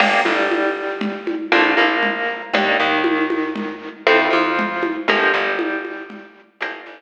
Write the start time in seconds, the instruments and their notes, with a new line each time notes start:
0.00 electric bass (finger) G1, acoustic guitar (steel) A#3 D4 F4 G4, crash, low conga
0.25 electric bass (finger) G1, acoustic guitar (steel) G3, high conga
0.51 high conga
1.01 low conga
1.27 high conga
1.52 electric bass (finger) A#1, acoustic guitar (steel) A3 A#3 D4 F4, high conga
1.77 electric bass (finger) A#1, acoustic guitar (steel) A#3, high conga
2.03 low conga
2.53 electric bass (finger) D#2, acoustic guitar (steel) G3 A#3 D4 D#4, low conga
2.80 electric bass (finger) D#2, acoustic guitar (steel) D#3
3.04 high conga
3.30 high conga
3.56 low conga
4.07 electric bass (finger) F2, acoustic guitar (steel) F3 A3 C4 E4, high conga
4.30 electric bass (finger) F2, acoustic guitar (steel) F3, high conga
4.59 low conga
4.83 high conga
5.08 electric bass (finger) G1, acoustic guitar (steel) F3 G3 A#3 D4, low conga
5.33 electric bass (finger) G1, acoustic guitar (steel) G3
5.59 high conga
5.85 high conga
6.10 low conga
6.61 electric bass (finger) G1, acoustic guitar (steel) F3 G3 A#3 D4, high conga
6.86 electric bass (finger) G1, acoustic guitar (steel) G3, high conga